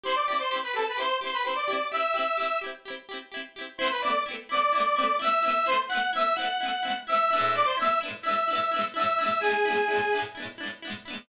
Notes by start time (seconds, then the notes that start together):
0.04 E4 G4 C5 C6
0.08 C4
0.15 D5 D6
0.28 E4 G4 D5 D6
0.33 C4
0.39 C5 C6
0.51 E4 G4
0.56 C4
0.63 B4 B5
0.74 E4 G4 A4 A5
0.79 C4
0.88 B4 B5
0.97 E4 G4 C5 C6
1.02 C4
1.21 E4 G4 C5 C6
1.26 C4
1.33 B4 B5
1.44 E4 G4 C5 C6
1.49 C4
1.55 D5 D6
1.68 E4 G4
1.73 C4
1.91 E4 G4 E5 E6
1.97 C4
2.14 E4 G4
2.19 C4
2.37 E4 G4
2.42 C4
2.61 E4 G4
2.66 C4
2.85 E4 G4
2.90 C4
3.09 E4 G4
3.14 C4
3.32 E4 G4
3.37 C4
3.56 E4 G4
3.61 C4
3.78 C4 E4 C5 C6
3.84 A3 B3
3.90 B4 B5
4.01 C4 E4 D5 D6
4.07 A3 B3
4.26 C4 E4
4.31 A3 B3
4.49 C4 E4 D5 D6
4.54 A3 B3
4.73 C4 E4
4.78 A3 B3
4.96 C4 E4
5.01 A3 B3
5.19 C4 E4 E5 E6
5.24 A3 B3
5.43 C4 E4
5.48 A3 B3
5.66 C4 E4 C5 C6
5.71 A3 B3
5.88 C4 E4 F#5 F#6
5.95 A3 B3
6.13 C4 E4 E5 E6
6.18 A3 B3
6.35 C4 E4 F#5 F#6
6.42 A3 B3
6.60 C4 E4
6.65 A3 B3
6.83 C4 E4
6.88 A3 B3
7.07 C4 E4 E5 E6
7.12 A3 B3
7.31 D4 E4
7.36 G#3 B3
7.41 A2
7.55 D5 D6
7.64 C5 C6
7.77 D4 E4 E5 E6
7.82 G#3 B3
7.87 A2
8.01 D4 E4
8.06 G#3 B3
8.11 A2
8.22 D4 E4 E5 E6
8.28 G#3 B3
8.33 A2
8.48 D4 E4
8.53 G#3 B3
8.58 A2
8.71 D4 E4
8.76 G#3 B3
8.81 A2
8.94 D4 E4 E5 E6
8.99 G#3 B3
9.04 A2
9.19 D4 E4
9.24 G#3 B3
9.29 A2
9.40 D4 E4 G#4 G#5
9.46 G#3 B3
9.51 A2
9.65 D4 E4
9.70 G#3 B3
9.75 A2
9.88 D4 E4
9.93 G#3 B3
9.98 A2
10.12 D4 E4
10.17 G#3 B3
10.22 A2
10.35 D4 E4
10.40 G#3 B3
10.45 A2
10.58 D4 E4
10.63 G#3 B3
10.68 A2
10.82 D4 E4
10.87 G#3 B3
10.92 A2
11.05 D4 E4
11.10 G#3 B3
11.15 A2